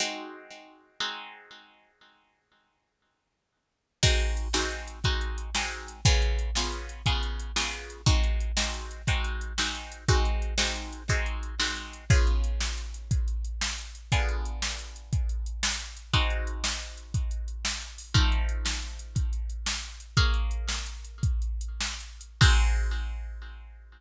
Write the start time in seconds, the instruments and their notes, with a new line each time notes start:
0.00 acoustic guitar (steel) G#3 C4 D#4 F#4
1.00 acoustic guitar (steel) G#3 C4 D#4 F#4
4.03 acoustic guitar (steel) G#3 C4 D#4 F#4, kick, crash
4.20 closed hi-hat
4.37 closed hi-hat
4.54 acoustic guitar (steel) G#3 C4 D#4 F#4, snare
4.71 closed hi-hat
4.88 closed hi-hat
5.04 acoustic guitar (steel) G#3 C4 D#4 F#4, kick, closed hi-hat
5.21 closed hi-hat
5.38 closed hi-hat
5.55 acoustic guitar (steel) G#3 C4 D#4 F#4, snare
5.71 closed hi-hat
5.88 closed hi-hat
6.05 acoustic guitar (steel) C#3 B3 F4 G#4, kick, closed hi-hat
6.22 closed hi-hat
6.39 closed hi-hat
6.55 acoustic guitar (steel) C#3 B3 F4 G#4, snare
6.72 closed hi-hat
6.89 closed hi-hat
7.06 acoustic guitar (steel) C#3 B3 F4 G#4, kick, closed hi-hat
7.23 closed hi-hat
7.39 closed hi-hat
7.56 acoustic guitar (steel) C#3 B3 F4 G#4, snare
7.73 closed hi-hat
7.90 closed hi-hat
8.06 acoustic guitar (steel) G#3 C4 D#4 F#4, kick, closed hi-hat
8.23 closed hi-hat
8.40 closed hi-hat
8.57 acoustic guitar (steel) G#3 C4 D#4 F#4, snare
8.74 closed hi-hat
8.91 closed hi-hat
9.07 acoustic guitar (steel) G#3 C4 D#4 F#4, kick, closed hi-hat
9.24 closed hi-hat
9.41 closed hi-hat
9.58 acoustic guitar (steel) G#3 C4 D#4 F#4, snare
9.75 closed hi-hat
9.92 closed hi-hat
10.08 acoustic guitar (steel) G#3 C4 D#4 F#4, kick, closed hi-hat
10.25 closed hi-hat
10.42 closed hi-hat
10.58 acoustic guitar (steel) G#3 C4 D#4 F#4, snare
10.76 closed hi-hat
10.93 closed hi-hat
11.09 acoustic guitar (steel) G#3 C4 D#4 F#4, kick, closed hi-hat
11.26 closed hi-hat
11.43 closed hi-hat
11.60 acoustic guitar (steel) G#3 C4 D#4 F#4, snare
11.77 closed hi-hat
11.93 closed hi-hat
12.10 acoustic guitar (steel) C#3 B3 F4 G#4, kick, closed hi-hat
12.27 closed hi-hat
12.44 closed hi-hat
12.61 snare
12.77 closed hi-hat
12.94 closed hi-hat
13.11 kick, closed hi-hat
13.28 closed hi-hat
13.45 closed hi-hat
13.61 snare
13.78 closed hi-hat
13.95 closed hi-hat
14.12 acoustic guitar (steel) D3 B3 F4 G#4, kick, closed hi-hat
14.29 closed hi-hat
14.45 closed hi-hat
14.62 snare
14.79 closed hi-hat
14.96 closed hi-hat
15.13 kick, closed hi-hat
15.29 closed hi-hat
15.46 closed hi-hat
15.63 snare
15.80 closed hi-hat
15.96 closed hi-hat
16.13 acoustic guitar (steel) G#3 C4 D#4 F#4, kick, closed hi-hat
16.30 closed hi-hat
16.47 closed hi-hat
16.64 snare
16.81 closed hi-hat
16.97 closed hi-hat
17.14 kick, closed hi-hat
17.31 closed hi-hat
17.48 closed hi-hat
17.65 snare
17.82 closed hi-hat
17.98 open hi-hat
18.14 acoustic guitar (steel) F3 A3 C4 D#4, kick, closed hi-hat
18.32 closed hi-hat
18.49 closed hi-hat
18.66 snare
18.82 closed hi-hat
18.99 closed hi-hat
19.16 kick, closed hi-hat
19.33 closed hi-hat
19.50 closed hi-hat
19.66 snare
19.83 closed hi-hat
20.00 closed hi-hat
20.17 acoustic guitar (steel) A#3 G#4 C#5 F5, kick, closed hi-hat
20.34 closed hi-hat
20.51 closed hi-hat
20.69 snare
20.86 closed hi-hat
21.04 closed hi-hat
21.23 kick, closed hi-hat
21.42 closed hi-hat
21.61 closed hi-hat
21.81 snare
22.00 closed hi-hat
22.21 closed hi-hat
22.41 acoustic guitar (steel) G#3 C4 D#4 F#4, kick, crash